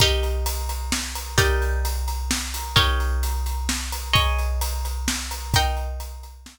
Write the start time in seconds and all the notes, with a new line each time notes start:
0.00 D#4 G4 A#4, kick, closed hi-hat
0.23 closed hi-hat
0.46 closed hi-hat
0.69 closed hi-hat
0.92 snare
1.15 closed hi-hat
1.38 D#4 G4 A#4 D5, kick, closed hi-hat
1.62 closed hi-hat
1.85 closed hi-hat
2.08 closed hi-hat
2.31 snare
2.54 closed hi-hat
2.76 D#4 G4 A#4 C#5, kick, closed hi-hat
3.00 closed hi-hat
3.23 closed hi-hat
3.46 closed hi-hat
3.69 snare
3.92 closed hi-hat
4.13 G#4 C#5 D#5, kick, closed hi-hat
4.39 closed hi-hat
4.61 closed hi-hat
4.85 closed hi-hat
5.08 snare
5.31 closed hi-hat
5.54 D#4 A#4 G5, kick, closed hi-hat
5.77 closed hi-hat
6.00 closed hi-hat
6.23 closed hi-hat
6.46 snare